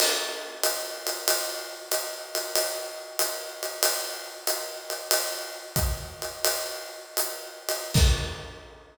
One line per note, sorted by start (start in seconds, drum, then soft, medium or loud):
0.00 crash loud
0.00 ride loud
0.63 hi-hat pedal medium
0.63 ride loud
1.07 ride medium
1.28 ride loud
1.91 hi-hat pedal medium
1.91 ride loud
2.35 ride medium
2.55 ride loud
3.19 hi-hat pedal loud
3.19 ride loud
3.63 ride medium
3.83 ride loud
4.47 hi-hat pedal loud
4.47 ride loud
4.90 ride medium
5.11 ride loud
5.76 kick medium
5.76 hi-hat pedal loud
5.76 ride medium
6.22 ride medium
6.45 ride loud
7.17 hi-hat pedal loud
7.17 ride medium
7.69 ride loud
7.94 kick loud
7.94 crash loud